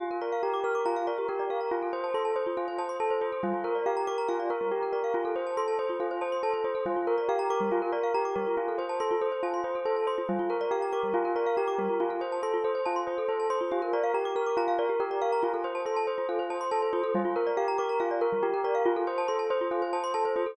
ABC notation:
X:1
M:4/4
L:1/16
Q:1/4=140
K:Gdor
V:1 name="Tubular Bells"
F2 B2 G2 B2 F2 B2 G2 B2 | F2 c2 A2 c2 F2 c2 A2 c2 | F2 B2 G2 B2 F2 B2 G2 B2 | F2 c2 A2 c2 F2 c2 A2 c2 |
F2 B2 G2 B2 F2 B2 G2 B2 | F2 c2 A2 c2 F2 c2 A2 c2 | F2 B2 G2 B2 F2 B2 G2 B2 | F2 c2 A2 c2 F2 c2 A2 c2 |
F2 B2 G2 B2 F2 B2 G2 B2 | F2 c2 A2 c2 F2 c2 A2 c2 | F2 B2 G2 B2 F2 B2 G2 B2 | F2 c2 A2 c2 F2 c2 A2 c2 |]
V:2 name="Glockenspiel"
G B d f b d' f' d' b f d G B d f b | F A c a c' a c F A c a c' a c F A | G, F B d f b d' b f d B G, F B d f | F A c a c' a c F A c a c' a c F A |
G, F B d f b d' G, F B d f b d' G, F | F A c a c' F A c a c' F A c a c' F | G, F B d f b d' G, F B d f b d' G, F | F A c a c' F A c a c' F A c a c' F |
G B d f b d' f' d' b f d G B d f b | F A c a c' a c F A c a c' a c F A | G, F B d f b d' b f d B G, F B d f | F A c a c' a c F A c a c' a c F A |]